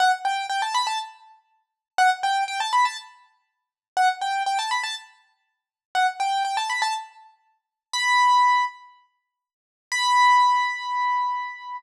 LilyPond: \new Staff { \time 4/4 \key b \minor \tempo 4 = 121 fis''16 r16 g''8 g''16 a''16 b''16 a''16 r2 | fis''16 r16 g''8 g''16 a''16 b''16 a''16 r2 | fis''16 r16 g''8 g''16 a''16 b''16 a''16 r2 | fis''16 r16 g''8 g''16 a''16 b''16 a''16 r2 |
b''4. r2 r8 | b''1 | }